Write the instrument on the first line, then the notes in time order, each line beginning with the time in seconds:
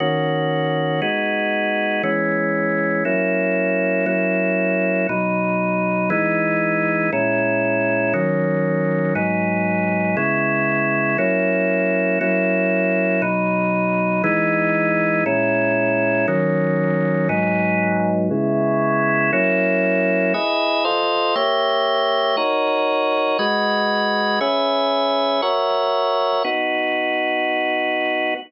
drawbar organ
0.00 D#3 A#3 C#4 F#4
1.02 G#3 B3 D#4 F#4
2.03 E3 G#3 B3 C#4
3.05 F#3 A#3 C#4 E4
4.06 F#3 A#3 C#4 E4
5.09 B2 F#3 D#4
6.10 E3 G#3 B3 D#4
7.13 A#2 G#3 C#4 E4
8.13 D#3 F#3 A#3 C#4
9.15 G#2 F#3 B3 D#4
10.17 C#3 G#3 B3 E4
11.18 F#3 A#3 C#4 E4
12.21 F#3 A#3 C#4 E4
13.22 B2 F#3 D#4
14.24 E3 G#3 B3 D#4
15.26 A#2 G#3 C#4 E4
16.28 D#3 F#3 A#3 C#4
17.29 G#2 F#3 B3 D#4
18.31 C#3 G#3 B3 E4
19.33 F#3 A#3 C#4 E4
20.34 E4 G#4 B4 D#5
20.85 F4 A4 C5 D#5
21.35 A#3 G4 C#5 E5
22.37 D#4 F#4 A#4 C#5
23.39 G#3 F#4 B4 D#5
24.41 C#4 G#4 B4 E5
25.42 F#4 A#4 C#5 E5
26.44 B3 D#4 F#4